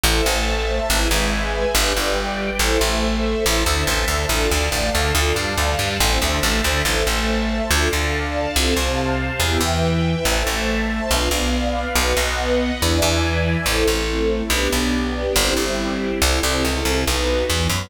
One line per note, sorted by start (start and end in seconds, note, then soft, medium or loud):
0.04 0.22 A1 loud
0.04 0.24 E4 medium
0.04 0.24 A4 medium
0.04 0.89 C5 medium
0.04 0.24 C5 medium
0.04 0.89 E5 medium
0.04 0.89 A5 medium
0.25 0.80 A1 medium
0.25 0.79 A3 medium
0.89 1.08 G#1 loud
0.89 1.09 E4 medium
0.89 1.09 G#4 medium
0.89 1.74 B4 medium
0.89 1.09 B4 medium
0.89 1.74 E5 medium
0.89 1.74 G#5 medium
1.10 1.65 G#1 medium
1.10 1.65 G#3 medium
1.74 1.93 G1 loud
1.74 1.93 D4 medium
1.74 1.93 G4 medium
1.74 1.93 B4 medium
1.74 2.59 B4 medium
1.74 2.59 D5 medium
1.74 2.59 G5 medium
1.96 2.51 G1 medium
1.96 2.50 G3 medium
2.59 2.77 A1 medium
2.59 2.79 E4 medium
2.59 3.44 A4 medium
2.59 2.79 A4 medium
2.59 3.44 C5 medium
2.59 2.79 C5 medium
2.59 3.44 E5 medium
2.81 3.35 A1 medium
2.81 3.37 A3 medium
3.44 3.64 A1 loud
3.44 3.63 E4 medium
3.44 3.63 A4 medium
3.44 3.63 C5 medium
3.44 4.29 C5 medium
3.44 4.29 E5 loud
3.44 4.29 A5 medium
3.66 3.84 D2 medium
3.66 3.84 D3 medium
3.87 4.05 A1 medium
3.87 4.05 A3 medium
4.07 4.26 D2 medium
4.07 4.26 D3 medium
4.29 4.47 A1 medium
4.29 4.49 D4 medium
4.29 4.49 F4 medium
4.29 4.49 A4 medium
4.29 5.14 D5 medium
4.29 5.14 F5 medium
4.29 5.14 A5 medium
4.51 4.70 D2 medium
4.51 4.69 D3 medium
4.72 4.90 A1 medium
4.72 4.90 A3 medium
4.94 5.13 D2 medium
4.94 5.12 D3 medium
5.15 5.33 D2 loud
5.15 5.35 D4 medium
5.15 5.35 F4 medium
5.15 5.35 A4 medium
5.15 5.99 D5 medium
5.15 5.99 F5 medium
5.15 5.99 A5 medium
5.36 5.54 G2 medium
5.36 5.54 G3 medium
5.58 5.76 D2 medium
5.58 5.76 D3 medium
5.79 5.97 G2 medium
5.79 5.98 G3 medium
6.00 6.18 A1 loud
6.00 6.19 C4 medium
6.00 6.19 E4 medium
6.00 6.19 A4 medium
6.00 6.84 C5 medium
6.00 6.84 E5 medium
6.00 6.84 A5 medium
6.22 6.40 D2 medium
6.22 6.40 D3 medium
6.43 6.61 A1 loud
6.43 6.61 A3 medium
6.64 6.82 D2 medium
6.64 6.82 D3 medium
6.85 7.03 A1 medium
6.85 7.04 E4 medium
6.85 7.04 A4 medium
6.85 7.04 C5 medium
6.85 7.69 C5 medium
6.85 7.69 E5 medium
6.85 7.69 A5 medium
7.07 7.61 A1 medium
7.07 7.62 A3 medium
7.70 7.89 D2 loud
7.70 7.89 D4 medium
7.70 7.89 F4 medium
7.70 7.89 A4 medium
7.70 8.55 D5 medium
7.70 8.55 F5 medium
7.70 8.55 A5 medium
7.91 8.47 D2 medium
7.91 8.46 D3 medium
8.55 8.74 C2 medium
8.55 8.74 C4 medium
8.55 8.74 F4 medium
8.55 8.74 A4 medium
8.55 9.40 C5 medium
8.55 9.40 F5 medium
8.55 9.40 A5 medium
8.77 9.31 C2 medium
8.77 9.31 C3 medium
9.40 9.58 E2 medium
9.40 9.60 B3 medium
9.40 9.60 E4 medium
9.40 9.60 G4 medium
9.40 10.25 B4 medium
9.40 10.25 E5 medium
9.40 10.25 G5 medium
9.61 10.15 E2 medium
9.61 10.15 E3 medium
10.25 10.43 A1 medium
10.25 10.46 E4 medium
10.25 10.46 A4 medium
10.25 11.10 C5 medium
10.25 10.46 C5 medium
10.25 11.10 E5 medium
10.25 11.10 A5 medium
10.47 11.01 A1 medium
10.47 11.02 A3 medium
11.11 11.29 B1 medium
11.11 11.30 D4 medium
11.11 11.30 F4 medium
11.11 11.30 B4 medium
11.11 11.95 B4 medium
11.11 11.95 D5 medium
11.11 11.95 F5 medium
11.31 11.85 B1 medium
11.31 11.87 B3 medium
11.95 12.14 B1 loud
11.95 12.15 D#4 medium
11.95 12.15 F#4 medium
11.95 12.15 B4 medium
11.95 12.80 B4 medium
11.95 12.80 D#5 medium
11.95 12.80 F#5 medium
12.17 12.71 B1 medium
12.17 12.71 B3 medium
12.80 13.00 E2 medium
12.80 12.99 D4 medium
12.80 12.99 E4 medium
12.80 12.99 G#4 medium
12.80 12.99 B4 medium
12.80 13.65 B4 medium
12.80 13.65 D5 medium
12.80 13.65 E5 medium
12.80 13.65 G#5 medium
13.02 13.56 E2 loud
13.02 13.57 E3 medium
13.66 13.84 A1 medium
13.66 14.50 C4 medium
13.66 14.50 E4 medium
13.66 13.86 E4 medium
13.66 14.50 A4 medium
13.66 13.86 A4 medium
13.66 13.86 C5 medium
13.88 14.42 A1 medium
13.88 14.43 A3 medium
14.50 14.68 B1 medium
14.50 15.35 B3 medium
14.50 14.70 D4 medium
14.50 15.35 D4 medium
14.50 14.70 G4 medium
14.50 15.35 G4 medium
14.50 14.70 B4 medium
14.72 15.27 B1 medium
14.72 15.26 B3 medium
15.35 15.54 G1 loud
15.35 16.20 C4 medium
15.35 15.54 E4 medium
15.35 16.20 E4 medium
15.35 15.54 G4 medium
15.35 16.20 G4 medium
15.35 15.54 C5 medium
15.57 16.11 G1 medium
15.57 16.12 G3 medium
16.21 16.40 C2 loud
16.21 17.06 C4 medium
16.21 17.06 E4 medium
16.21 16.41 E4 medium
16.21 17.06 A4 medium
16.21 16.41 A4 medium
16.21 16.41 C5 medium
16.43 16.64 C2 medium
16.43 16.63 C3 medium
16.64 16.84 C#2 medium
16.64 16.83 C#3 medium
16.85 17.04 C2 medium
16.85 17.04 C3 medium
17.06 17.44 B1 medium
17.06 17.49 B3 medium
17.06 17.49 D#4 medium
17.06 17.45 D#4 medium
17.06 17.49 F#4 medium
17.06 17.45 F#4 medium
17.06 17.45 B4 medium
17.49 17.68 E2 medium
17.49 17.68 E3 medium
17.49 17.90 B3 medium
17.49 17.90 F#4 medium
17.49 17.90 B4 medium
17.70 17.88 F#2 medium
17.70 17.88 F#3 medium